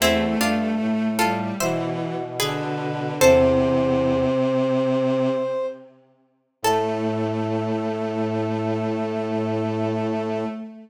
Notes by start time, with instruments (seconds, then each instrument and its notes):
0.00 brass section E2, violin A3, harpsichord C4 E4
0.40 brass section G2, harpsichord D4 F4
0.80 brass section A2
1.19 violin G3, harpsichord F4 A4
1.60 brass section B2, violin E3, harpsichord C5 E5
2.40 violin D3, harpsichord G#4 B4, brass section B4
3.19 brass section E2 C5, violin C3, harpsichord A4 C5
6.62 brass section A2 A4, violin A3, harpsichord A4